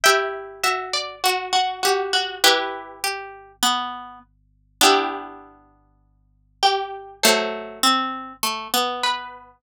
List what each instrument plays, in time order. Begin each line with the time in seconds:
0.04 pizzicato strings E4 G4, harpsichord E5 G5
0.64 pizzicato strings F#4, harpsichord E5
0.93 harpsichord D5
1.24 harpsichord F#4, pizzicato strings F#4
1.53 harpsichord F#4
1.83 harpsichord F#4, pizzicato strings G4
2.13 harpsichord F#4
2.44 pizzicato strings E4 G4, harpsichord G4 B4
3.04 pizzicato strings G4
3.63 pizzicato strings B3
4.81 pizzicato strings B3 D4, harpsichord E4 G4
6.63 harpsichord G4
7.23 pizzicato strings F#3 A3, harpsichord A4 C5
7.83 pizzicato strings C4
8.43 pizzicato strings A3
8.74 pizzicato strings B3
9.03 harpsichord B4